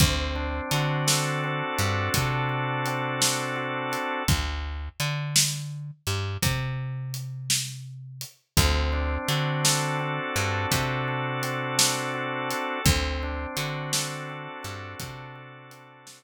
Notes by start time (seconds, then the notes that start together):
0.00 D2 C4, kick, closed hi-hat
0.35 D4
0.71 D3 F#4, closed hi-hat
1.07 A4, snare
1.44 C4
1.79 G2 D4, closed hi-hat
2.14 C3 F#4, kick, closed hi-hat
2.49 A4
2.86 C4, closed hi-hat
3.21 D4, snare
3.56 F#4
3.92 A4, closed hi-hat
4.28 D2, kick, closed hi-hat
5.00 D3, closed hi-hat
5.36 snare
6.07 G2, closed hi-hat
6.42 C3, kick, closed hi-hat
7.14 closed hi-hat
7.50 snare
8.21 closed hi-hat
8.57 D2 C4, kick, closed hi-hat
8.93 D4
9.28 D3 F#4, closed hi-hat
9.64 A4, snare
10.00 C4
10.36 G2 D4, closed hi-hat
10.71 C3 F#4, kick, closed hi-hat
11.08 A4
11.43 C4, closed hi-hat
11.78 D4, snare
12.14 F#4
12.51 A4, closed hi-hat
12.85 D2 C4, kick, closed hi-hat
13.23 D4
13.56 D3 F#4, closed hi-hat
13.93 A4, snare
14.30 C4
14.63 G2 D4, closed hi-hat
15.00 C3 F#4, kick, closed hi-hat
15.35 A4
15.71 C4, closed hi-hat
16.07 D4, snare